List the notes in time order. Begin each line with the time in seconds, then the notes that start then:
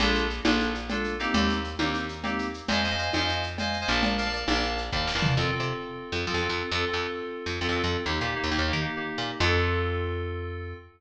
0.00 A#1 A#3 D4 F4 A4, cowbell, low conga, shaker
0.15 shaker
0.30 shaker
0.44 A#1 A#3 D4 F4 A4, cowbell, high conga, shaker
0.60 shaker
0.75 shaker
0.89 A#3 D4 F4 A4, cowbell, low conga, shaker
1.04 shaker
1.19 A#3 C4 D#4 G4, shaker
1.34 D#2, cowbell, low conga, shaker
1.49 shaker
1.64 shaker
1.79 D#2 A#3 C4 D#4 G4, cowbell, high conga, shaker
1.94 shaker
2.09 shaker
2.23 A#3 C4 D#4 G4, cowbell, low conga, shaker
2.39 shaker
2.54 shaker
2.68 F2 C5 D#5 F5 G#5, cowbell, low conga, shaker
2.83 C5 D#5 F5 G#5, shaker
2.90 C5 D#5 F5 G#5
2.98 C5 D#5 F5 G#5, shaker
3.13 F2 C5 D#5 F5 G#5, cowbell, high conga, shaker
3.19 C5 D#5 F5 G#5
3.28 shaker
3.43 shaker
3.58 C5 D#5 F5 G#5, cowbell, low conga, shaker
3.73 shaker
3.81 C5 D#5 F5 G#5
3.88 A#1 A#4 D5 F5 A5, shaker
4.03 cowbell, low conga, shaker
4.18 A#4 D5 F5 A5, shaker
4.25 A#4 D5 F5 A5
4.32 A#4 D5 F5 A5, shaker
4.48 A#1 A#4 D5 F5 A5, cowbell, high conga, shaker
4.55 A#4 D5 F5 A5
4.63 shaker
4.78 shaker
4.92 D#2 A#4 D5 F5 A5, kick
5.07 snare
5.15 E2 A#4 D5 F5 A5
5.22 floor tom
5.37 F2 C4 F4 A4
5.51 C4 F4 A4
5.60 C3
6.12 F2
6.26 F3 C4 F4 A4
6.34 F2
6.41 C4 F4 A4
6.49 F2
6.71 F2 C4 F4 A4
6.87 C4 F4 A4
6.94 F2
7.46 F2
7.60 F2 C4 F4 A4
7.69 F2
7.75 C4 F4 A4
7.84 F2
8.06 D#2 A#3 D#4 G4
8.21 A#2 A#3 D#4 G4
8.35 A#3 D#4 G4
8.44 D#2
8.51 D#2 A#3 D#4 G4
8.58 D#2
8.67 A#3 D#4 G4
8.73 D#3
8.81 A#3 D#4 G4
8.96 A#3 D#4 G4
9.18 A#2
9.40 F2 C4 F4 A4